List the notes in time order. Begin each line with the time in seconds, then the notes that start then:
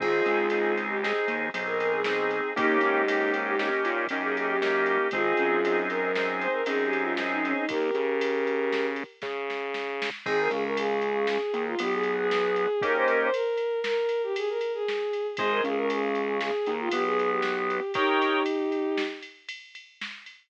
0.00 G#1 C4 D#4 F4 G#4, kick, crash
0.26 C#2, ride
0.50 C4 D#4 G#4, ride
0.77 ride
0.89 G4
1.03 C4 D#4 G#4, snare
1.28 D#2, ride
1.54 B1 C4 D#4 G#4, ride
1.66 A#4
1.80 A#4, ride
1.93 G#4
2.04 C4 D#4 G#4, snare
2.31 ride
2.56 D#2 A#3 C#4 D#4 G4, kick, ride
2.81 G#2, ride
3.08 A#3 C#4 D#4 G4, ride
3.34 ride
3.47 G4
3.59 A#3 C#4 D#4 G4, snare
3.85 A#2, ride
4.09 F#2 A#3 C#4 D#4 G4, ride
4.22 G#4
4.35 G#4, ride
4.49 G4
4.62 A#3 C#4 D#4 G4, snare
4.86 ride
5.11 G#1 C4 D#4 F4 G#4, kick, ride
5.37 F#2, ride
5.64 C4 D#4 G#4, ride
5.90 A#4, ride
6.02 A#4
6.15 C4 D#4 G#4, snare
6.41 C5, ride
6.53 A#4
6.66 F#2 C4 D#4 G#4, ride
6.84 G4
6.93 ride
7.01 F4
7.17 C4 D#4 G#4, snare
7.31 D#4
7.44 C#4, ride
7.57 D#4
7.69 D#2 G4 A#4, kick, ride
7.94 C#3, ride
8.21 ride
8.47 ride
8.73 snare
8.96 ride
9.22 C#3, kick, snare
9.50 snare
9.74 snare
10.02 snare
10.26 G#1 C4 D#4 G#4, kick, crash
10.40 A#4
10.51 C#2 C#3 G#4, ride
10.64 A#4
10.77 G#4, ride
11.02 ride
11.27 G#4, snare
11.54 D#2 D#3, ride
11.67 F4
11.79 B1 B3 G4, ride
11.93 G#4
12.03 ride
12.17 G#4
12.31 snare
12.56 ride
12.81 A#3 C#4 D#4 G4 A#4, kick, ride
12.96 C5
13.07 A#4, ride
13.21 C5
13.33 A#4, ride
13.57 ride
13.84 A#4, snare
14.09 ride
14.23 G4
14.36 G#4, ride
14.49 A#4
14.61 ride
14.74 G#4
14.88 snare
15.13 ride
15.37 G#1 G#4 C5 D#5 G#5, kick, ride
15.51 A#4
15.64 C#2 C#3 G#4, ride
15.77 A#4
15.90 G#4, ride
16.15 ride
16.40 G#4, snare
16.66 D#2 D#3, ride
16.80 F4
16.91 B1 B3 G4, ride
17.05 G#4
17.19 ride
17.30 G4
17.42 snare
17.70 ride
17.94 D#4 G4 A#4 C#5 D#5 G5, kick, ride
18.22 ride
18.46 ride
18.72 ride
18.97 snare
19.22 ride
19.49 ride
19.75 ride
20.01 snare
20.26 ride